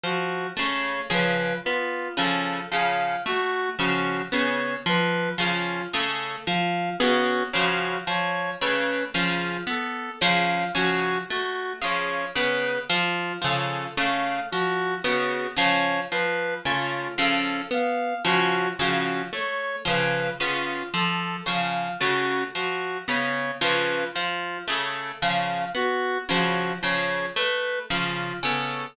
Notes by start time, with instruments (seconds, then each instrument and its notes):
0.04 orchestral harp F3, clarinet F#4
0.57 orchestral harp C#3 A3, clarinet C#5
1.10 orchestral harp C#3 F3, clarinet B4
1.65 orchestral harp B3, clarinet F4
2.17 orchestral harp C#3 F3, clarinet A4
2.72 orchestral harp C#3 F3, clarinet F5
3.26 orchestral harp A3, clarinet F#4
3.79 orchestral harp C#3 F3, clarinet F#4
4.32 orchestral harp C#3 B3, clarinet C#5
4.86 orchestral harp F3, clarinet B4
5.38 orchestral harp C#3 F3, clarinet F4
5.93 orchestral harp C#3 A3, clarinet A4
6.46 orchestral harp F3, clarinet F5
7.00 orchestral harp C#3 B3, clarinet F#4
7.54 orchestral harp C#3 F3, clarinet F#4
8.07 orchestral harp F3, clarinet C#5
8.61 orchestral harp C#3 A3, clarinet B4
9.14 orchestral harp C#3 F3, clarinet F4
9.67 orchestral harp B3, clarinet A4
10.21 orchestral harp C#3 F3, clarinet F5
10.75 orchestral harp C#3 F3, clarinet F#4
11.30 orchestral harp A3, clarinet F#4
11.82 orchestral harp C#3 F3, clarinet C#5
12.35 orchestral harp C#3 B3, clarinet B4
12.90 orchestral harp F3, clarinet F4
13.42 orchestral harp C#3 F3, clarinet A4
13.97 orchestral harp C#3 A3, clarinet F5
14.51 orchestral harp F3, clarinet F#4
15.04 orchestral harp C#3 B3, clarinet F#4
15.57 orchestral harp C#3 F3, clarinet C#5
16.11 orchestral harp F3, clarinet B4
16.65 orchestral harp C#3 A3, clarinet F4
17.18 orchestral harp C#3 F3, clarinet A4
17.71 orchestral harp B3, clarinet F5
18.25 orchestral harp C#3 F3, clarinet F#4
18.78 orchestral harp C#3 F3, clarinet F#4
19.33 orchestral harp A3, clarinet C#5
19.85 orchestral harp C#3 F3, clarinet B4
20.39 orchestral harp C#3 B3, clarinet F4
20.94 orchestral harp F3, clarinet A4
21.46 orchestral harp C#3 F3, clarinet F5
22.00 orchestral harp C#3 A3, clarinet F#4
22.55 orchestral harp F3, clarinet F#4
23.08 orchestral harp C#3 B3, clarinet C#5
23.61 orchestral harp C#3 F3, clarinet B4
24.14 orchestral harp F3, clarinet F4
24.68 orchestral harp C#3 A3, clarinet A4
25.21 orchestral harp C#3 F3, clarinet F5
25.75 orchestral harp B3, clarinet F#4
26.29 orchestral harp C#3 F3, clarinet F#4
26.83 orchestral harp C#3 F3, clarinet C#5
27.36 orchestral harp A3, clarinet B4
27.90 orchestral harp C#3 F3, clarinet F4
28.43 orchestral harp C#3 B3, clarinet A4